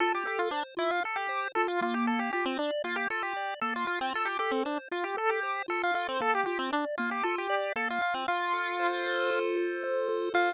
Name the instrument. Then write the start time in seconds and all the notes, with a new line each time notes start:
lead 1 (square)
0.00 F4 A4
0.15 G4
0.25 G4 A4
0.39 F4
0.51 D4 C5
0.77 E4 F4
0.91 F4
1.04 A4
1.16 G4
1.29 C5
1.55 F4 A4
1.68 F4
1.81 A#3 F4
1.94 G4
2.07 A4
2.19 G4
2.33 F4 G4
2.45 C4
2.59 D4 D5
2.84 A#3 F4
2.96 G4
3.10 F4 A4
3.23 G4
3.37 D5
3.61 A#3 A4
3.76 F4
3.87 F4
4.01 C4
4.14 F4 A4
4.25 G4
4.39 G4 A4
4.51 C4
4.65 D4 C5
4.91 F4
5.04 G4
5.17 A4
5.29 G4
5.43 C5
5.68 F4 A4
5.83 F4
5.94 F4 A4
6.09 C4
6.20 A#3 A4
6.35 G4
6.46 F4 G4
6.59 C4
6.72 D4 D5
6.98 A#3 F4
7.11 G4
7.23 F4 A4
7.38 G4
7.50 D5
7.76 A#3 A4
7.90 F4
8.01 F4
8.14 C4
8.28 F4
8.53 A4
8.79 C5
9.06 A4
9.31 F4
9.57 A4
9.84 C5
10.08 A4
10.34 F4 A4 C5